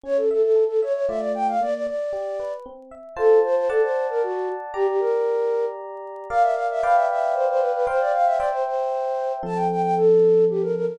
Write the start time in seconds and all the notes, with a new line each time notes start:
0.03 C#4 C#5
0.17 A4
0.31 A4 E5
0.42 A4
0.56 A4
0.68 A4
0.82 C#5 E5
0.93 C#5
1.08 A3 F4 D5 E5
1.20 D5
1.35 G5
1.48 F5
1.61 A#3 D5
1.74 D5
1.87 D5
2.13 G4
2.40 B4
2.66 C4
2.91 E5
3.16 F4 A4 C5 A5
3.45 C5
3.56 C5
3.69 A4 D5 F#5 A5
3.82 C5
4.10 A#4
4.23 F#4
4.74 G4 D5 A#5
4.88 G4
5.00 A#4
6.30 A#4 D5 F5
6.42 E5
6.54 F5
6.71 E5
6.83 B4 D5 F5 G5
6.95 E5
7.10 E5
7.34 C5
7.48 C5
7.60 B4
7.73 B4
7.87 C5 F5 G5
8.00 D5
8.13 F5
8.25 E5
8.37 C5 D5 E5 G5
8.51 C5
8.66 C5
9.43 F3 C4 A4 A5
9.55 G5
9.71 G5
9.82 G5
9.97 A4
10.50 G4
10.62 A#4
10.76 A#4
10.86 A#4